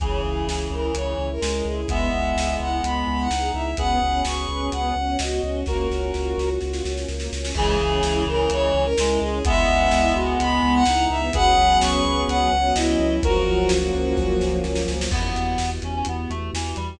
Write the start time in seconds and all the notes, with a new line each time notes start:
0.00 C#2 C#3 E3 C#4 E4 G#4, kick, closed hi-hat
0.24 C#2 E4
0.47 C#2 G#4, snare
0.71 C#2 E4 A#4
0.94 C#2 C#4 C#5, closed hi-hat
1.18 C#2 E4
1.32 A#4
1.41 C#2 G#3 G#4, snare
1.65 C#2 E4 G#4
1.88 C#2 G#3 B3 E4 G#4 E5, kick, closed hi-hat
2.13 C#2 E4
2.36 C#2 G#4, snare
2.60 C#2 E4 F#5
2.83 C#2 B3 B5, closed hi-hat
3.07 C#2 E4
3.20 F#5
3.29 C#2 D#4 G#4, snare
3.54 C#2 E4 E5
3.77 C#2 B3 C#4 F#4 G#4 B4 F#5, kick, closed hi-hat
4.02 C#2 C#4
4.25 C#2 F#4 C#6, snare
4.49 C#2 C#4
4.71 C#2 B3 F#5, closed hi-hat
4.96 C#2 C#4
5.19 C#2 F#4 D#5, snare
5.43 C#2 C#4
5.66 C#2 A#3 C#4 F4 F#4 A#4, kick, snare
5.91 C#2 C#4, snare
6.14 C#2 F4, snare
6.38 C#2 F#4, snare
6.61 C#2 F4, snare
6.73 snare
6.85 C#2 C#4, snare
6.97 snare
7.08 C#2 A#3, snare
7.20 snare
7.32 C#2 C#4, snare
7.45 snare
7.54 C#2 C#3 E3 G#3 C#4 E4 G#4, kick, crash
7.80 C#2 C#4
8.03 C#2 E4, snare
8.27 C#2 C#4 A#4
8.50 C#2 G#3 C#5, closed hi-hat
8.74 C#2 C#4
8.84 A#4
8.98 C#2 G#3 E4, snare
9.20 C#2 C#4 G#4
9.45 C#2 G#3 B3 E4 E5, kick, closed hi-hat
9.68 C#2 B3
9.91 C#2 E4, snare
10.14 C#2 B3 F#4
10.39 C#2 G#3 B5, closed hi-hat
10.63 C#2 B3
10.75 F#5
10.85 C#2 D#4 E4, snare
11.10 C#2 B3 E5
11.33 C#2 F#3 B3 C#4 G#4 B4 F#5, kick, closed hi-hat
11.57 C#2 B3
11.81 C#2 C#4 C#6, snare
12.05 C#2 B3
12.28 C#2 F#3 F#5, closed hi-hat
12.52 C#2 B3
12.75 C#2 C#4 E4 D#5, snare
12.99 C#2 B3
13.22 C#2 F3 F#3 A#3 C#4 F#4 A#4, kick, closed hi-hat
13.46 C#2 F#3
13.69 C#2 A#3, snare
13.94 C#2 C#4
14.17 C#2 A#3, kick, snare
14.41 C#2 F#3, snare
14.64 C#2 F3, snare
14.75 snare
14.88 C#2 F#3, snare
15.01 snare
15.11 E2 B3 E4 F#4 G4, kick, crash
15.36 E2, closed hi-hat
15.58 E2, snare
15.82 E2 C#4, closed hi-hat
15.95 C#4
16.05 E2 B3, closed hi-hat
16.30 E2 A3, closed hi-hat
16.53 E2 E3, snare
16.76 E2 G3, closed hi-hat